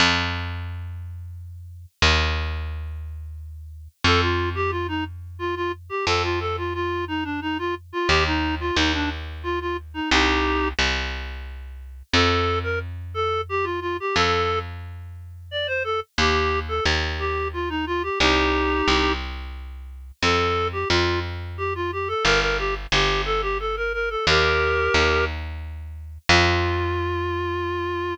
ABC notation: X:1
M:3/4
L:1/16
Q:1/4=89
K:Fmix
V:1 name="Clarinet"
z12 | z12 | A F2 G F E z2 F F z G | A F A F F2 E D E F z F |
G E2 F E D z2 F F z E | [EG]4 z8 | A3 B z2 A2 G F F G | A3 z5 d c A z |
G3 A z2 G2 F E F G | [EG]6 z6 | A3 G F2 z2 G F G A | B B G z G2 A G A B B A |
[GB]6 z6 | F12 |]
V:2 name="Electric Bass (finger)" clef=bass
F,,12 | E,,12 | F,,12 | F,,12 |
E,,4 E,,8 | C,,4 C,,8 | F,,12 | F,,12 |
E,,4 E,,8 | C,,4 C,,8 | F,,4 F,,8 | G,,,4 G,,,8 |
E,,4 E,,8 | F,,12 |]